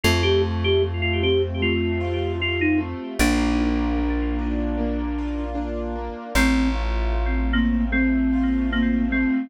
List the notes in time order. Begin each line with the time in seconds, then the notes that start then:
0.03 F2 A3 F4
0.23 G4
0.42 F4
0.64 G4
0.82 A3
1.02 F4
1.23 C4 G4
1.61 A3 F4
2.00 F4
2.40 C4 F4
2.61 D#4
2.78 A3
3.19 A#1 A#3 D4
3.59 F4
3.98 A#3
4.39 D4
4.78 A#3
5.18 F4
5.55 D4
5.96 A#3
6.35 A1 A3 C4
6.73 F4
7.13 A3
7.53 A#3 C4
7.92 A3 C4
8.33 F4
8.72 A#3 C4
9.12 A3 C4